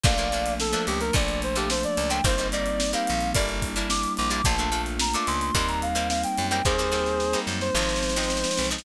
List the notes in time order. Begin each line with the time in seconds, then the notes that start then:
0.03 A#1 F3 A3 A#3 D4 D5 F5, kick, crash
0.18 F3 A3 A#3 D4, closed hi-hat
0.32 F3 A3 A#3 D4, closed hi-hat
0.46 closed hi-hat
0.60 A4, snare
0.72 F3 A3 A#3 D4, closed hi-hat
0.87 C#2 G4, snare, closed hi-hat
1.00 A#4, closed hi-hat
1.13 A#1 F3 A3 A#3 D4 D5, kick, closed hi-hat
1.28 closed hi-hat
1.42 C5, closed hi-hat
1.55 F3 A3 A#3 D4 G4, closed hi-hat
1.70 C5, snare
1.83 D5, closed hi-hat
1.97 C#2, closed hi-hat
2.10 F3 A3 A#3 D4 G5, closed hi-hat
2.24 G1 G3 A#3 C4 D#4 C5, kick, closed hi-hat
2.38 G3 A#3 C4 D#4, closed hi-hat
2.52 G3 A#3 C4 D#4 D5, snare, closed hi-hat
2.66 closed hi-hat
2.80 snare
2.93 G3 A#3 C4 D#4 F5, closed hi-hat
3.07 A#1, closed hi-hat
3.21 closed hi-hat
3.34 G1 G3 A#3 D4 E4 D5, kick, closed hi-hat
3.48 snare, closed hi-hat
3.62 kick, closed hi-hat
3.76 G3 A#3 D4 E4, closed hi-hat
3.90 D6, snare
4.03 closed hi-hat
4.17 A#1 D6, closed hi-hat
4.30 G3 A#3 D4 E4 D6, closed hi-hat
4.44 A#1 A3 A#3 D4 F4 A5, kick, closed hi-hat
4.58 A3 A#3 D4 F4, closed hi-hat
4.72 A3 A#3 D4 F4, closed hi-hat
4.86 closed hi-hat
4.99 A#5, snare
5.14 A3 A#3 D4 F4 D6, closed hi-hat
5.27 C#2 C6, closed hi-hat
5.41 C6, closed hi-hat
5.54 D#2 G3 A#3 C4 D#4 C6, kick, closed hi-hat
5.68 A#5, snare, closed hi-hat
5.82 F5, closed hi-hat
5.95 G3 A#3 C4 D#4, closed hi-hat
6.09 F5, snare
6.23 G5, closed hi-hat
6.38 F#2, closed hi-hat
6.50 G3 A#3 C4 D#4 G5, closed hi-hat
6.65 D#2 G3 A#3 C4 D#4 G#4 C5, kick, snare
6.78 G3 A#3 C4 D#4, snare
6.92 G3 A#3 C4 D#4, snare
7.06 snare
7.20 snare
7.33 G3 A#3 C4 D#4, snare
7.47 F#2, snare
7.61 C5, snare
7.75 G#1 F3 G#3 C4 D#4, snare
7.82 snare
7.89 snare
7.96 snare
8.03 snare
8.09 snare
8.16 F3 G#3 C4 D#4, snare
8.23 snare
8.30 snare
8.37 snare
8.44 snare
8.51 snare
8.57 B1, snare
8.64 snare
8.71 F3 G#3 C4 D#4, snare
8.78 snare